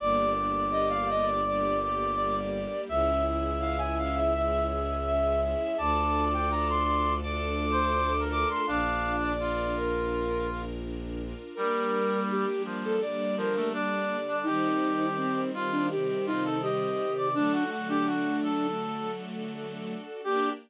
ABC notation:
X:1
M:4/4
L:1/16
Q:1/4=83
K:Gm
V:1 name="Flute"
d2 z2 e f e d d2 z2 d4 | =e2 z2 f ^g f e e2 z2 e4 | a3 g b c' c'2 d'6 d' c' | f3 d3 B4 z6 |
B4 G2 z A d2 B2 d4 | E4 C2 z D G2 E2 G4 | D2 z D5 z8 | G4 z12 |]
V:2 name="Brass Section"
d16 | =e16 | d8 (3d4 c4 B4 | D4 F8 z4 |
G,6 F,2 z2 F, A, D3 D | G6 F2 z2 F A e3 d | D ^F F G F2 A4 z6 | G4 z12 |]
V:3 name="String Ensemble 1"
B,2 D2 G2 B,2 D2 G2 B,2 D2 | ^C2 =E2 ^G2 C2 E2 G2 C2 E2 | D2 F2 A2 D2 F2 A2 D2 F2 | D2 F2 B2 D2 F2 B2 D2 F2 |
[G,B,D]16 | [E,G,C]16 | [D,^F,A,]16 | [B,DG]4 z12 |]
V:4 name="Violin" clef=bass
G,,,16 | ^C,,16 | D,,16 | B,,,16 |
z16 | z16 | z16 | z16 |]
V:5 name="String Ensemble 1"
[B,DG]8 [G,B,G]8 | [^C=E^G]8 [^G,CG]8 | [DFA]8 [A,DA]8 | z16 |
[G,B,D]8 [D,G,D]8 | [E,G,C]8 [C,E,C]8 | [D^FA]16 | [B,DG]4 z12 |]